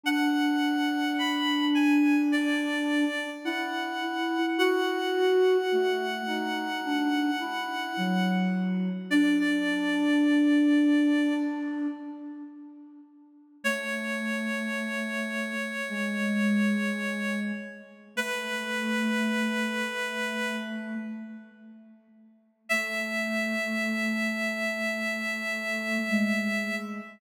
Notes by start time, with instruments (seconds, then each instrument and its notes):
0.04 flute D4, clarinet F#5
1.18 clarinet B5
1.75 clarinet G#5
2.32 clarinet D5
3.44 flute E4, clarinet F#5
4.58 flute F#4, clarinet F#5
5.72 flute A3
6.27 flute D#4
6.85 flute D4
7.40 flute E4
7.97 flute F#3
9.10 flute D4, clarinet D5
9.39 clarinet D5
13.64 flute A3, clarinet C#5
15.89 flute G#3
18.16 flute A3, clarinet B4
22.69 flute A3, clarinet E5
26.09 flute G#3